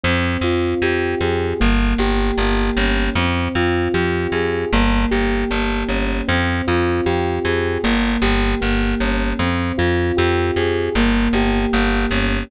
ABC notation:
X:1
M:4/4
L:1/8
Q:1/4=77
K:Fm
V:1 name="Electric Piano 2"
C F G A B, G B, D | C F G A B, G B, D | C F G A B, G B, D | C F G A B, G B, D |]
V:2 name="Electric Bass (finger)" clef=bass
F,, F,, F,, F,, G,,, G,,, G,,, G,,, | F,, F,, F,, F,, G,,, G,,, G,,, G,,, | F,, F,, F,, F,, G,,, G,,, G,,, G,,, | F,, F,, F,, F,, G,,, G,,, G,,, G,,, |]